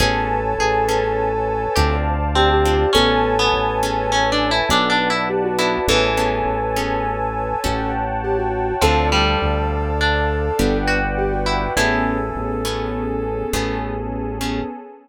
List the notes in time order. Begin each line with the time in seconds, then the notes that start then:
0.00 A1 B3 C#4 G#4 A4 B4 C#5 G#5 A5
0.59 A1 G#4
0.88 B3 C#4 G#4 A4
1.76 D2 C4 D4 F4 G4 A4 C5 D5 F5 A5
2.35 C4 G4
2.50 G4
2.65 C4 D4 F4 A4
2.93 A1 B3 C#4 G#4 A4 B4 C#5 G#5 A5
3.39 B3
3.52 A1
3.83 B3 C#4 G#4 A4
4.12 C#4
4.32 D4
4.51 E4
4.69 B1 B3 D4 F#4 A4 B4 D5 F#5 A5
4.90 D4
5.10 E4
5.30 G4
5.44 F#4
5.58 B3 D4 E4 F#4 A4
5.88 A1 E3 B3 C#4 G#4 A4 B4 C#5 G#5 A5
6.17 B3 C#4 G#4 A4
6.46 A1
6.76 B3 C#4 G#4 A4
7.64 A1 C#4 F#4 G4 A4 C#5 F#5 G5 A5
8.24 G4
8.38 F#4
8.81 D2 F3 C4 D4 F4 A4 C5 D5 F5 A5
9.12 G3
9.42 D2
10.01 D4
10.59 G1 B3 D4 F#4 G4 B4 D5 F#5 G5
10.87 F#4
11.18 G4
11.32 F#4
11.46 E4
11.76 A1 A3 B3 C#4 E4 G#4 A4
12.36 A1
12.65 A3 B3 C#4 G#4
13.52 A1 A3 B3 C#4 G#4 A4
14.41 A3 B3 C#4 G#4